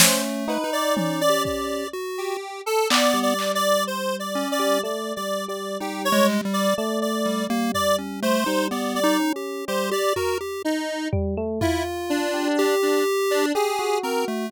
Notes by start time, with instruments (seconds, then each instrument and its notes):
0.00 lead 1 (square) A3 C5, electric piano 1 C#4, snare
0.48 electric piano 1 D#4, lead 1 (square) B4, cowbell
0.64 lead 1 (square) D#4
0.73 lead 1 (square) D5
0.96 electric piano 1 C#4, lead 1 (square) D5, high tom
1.21 lead 1 (square) D5
1.29 lead 1 (square) G4
1.45 lead 1 (square) D5, kick
1.93 lead 1 (square) F#4
2.18 lead 1 (square) G4
2.66 lead 1 (square) A4
2.90 lead 1 (square) B3 D5, clap
3.14 electric piano 1 G3
3.23 lead 1 (square) D5
3.39 clap
3.55 lead 1 (square) D5
3.87 lead 1 (square) C5
4.19 lead 1 (square) D5
4.35 lead 1 (square) C#4
4.52 lead 1 (square) D5
4.59 electric piano 1 G3
4.83 electric piano 1 A3, lead 1 (square) D5
5.16 electric piano 1 G3, lead 1 (square) D5
5.48 electric piano 1 G3, lead 1 (square) D5
5.80 electric piano 1 G3, lead 1 (square) D#4 G4
6.05 lead 1 (square) C#5
6.12 lead 1 (square) G#3
6.29 clap
6.45 lead 1 (square) G3
6.53 lead 1 (square) D5
6.77 electric piano 1 A3, lead 1 (square) D5
7.02 lead 1 (square) D5
7.26 lead 1 (square) G3
7.50 electric piano 1 G3, lead 1 (square) A#3
7.74 lead 1 (square) D5, floor tom
7.98 lead 1 (square) C#4
8.22 lead 1 (square) A3 C5
8.46 electric piano 1 G3, lead 1 (square) D#4
8.71 electric piano 1 G3, lead 1 (square) B3 D5
8.95 electric piano 1 G3, lead 1 (square) D5
9.04 lead 1 (square) D#4
9.19 electric piano 1 C#4
9.36 lead 1 (square) G4
9.68 electric piano 1 G3, lead 1 (square) G4 C5
9.91 lead 1 (square) G4 D5
10.16 lead 1 (square) F#4 A#4, floor tom
10.41 lead 1 (square) G4
10.65 lead 1 (square) D#4
11.13 electric piano 1 G3, floor tom
11.37 electric piano 1 A3
11.61 lead 1 (square) E4 F4, electric piano 1 F4, floor tom
12.10 lead 1 (square) D4
12.34 electric piano 1 G4
12.59 lead 1 (square) G4
12.82 lead 1 (square) D4
13.31 lead 1 (square) D4
13.55 lead 1 (square) G4 G#4, electric piano 1 G4
13.79 electric piano 1 F#4
14.03 lead 1 (square) C4 A#4
14.28 lead 1 (square) A3